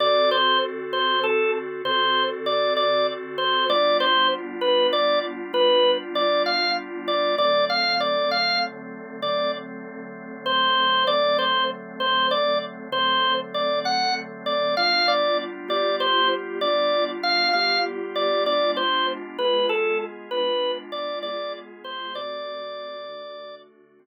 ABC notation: X:1
M:12/8
L:1/16
Q:3/8=65
K:D
V:1 name="Drawbar Organ"
d2 =c2 z2 c2 A2 z2 c3 z d2 d2 z2 c2 | d2 =c2 z2 B2 d2 z2 B3 z d2 =f2 z2 d2 | d2 =f2 d2 f2 z4 d2 z6 =c4 | d2 =c2 z2 c2 d2 z2 c3 z d2 f2 z2 d2 |
=f2 d2 z2 d2 =c2 z2 d3 z f2 f2 z2 d2 | d2 =c2 z2 B2 A2 z2 B3 z d2 d2 z2 c2 | d10 z14 |]
V:2 name="Drawbar Organ"
[D,=CFA]12 [D,CFA]12 | [G,B,D=F]12 [G,B,DF]12 | [D,F,A,=C]12 [D,F,A,C]12 | [D,F,A,=C]12 [D,F,A,C]12 |
[G,B,D=F]6 [G,B,FG]6 [G,B,DF]6 [G,B,FG]6 | [^G,B,D=F]6 [G,B,F^G]6 [G,B,DF]6 [G,B,FG]6 | [D,A,=CF]6 [D,A,DF]6 [D,A,CF]6 z6 |]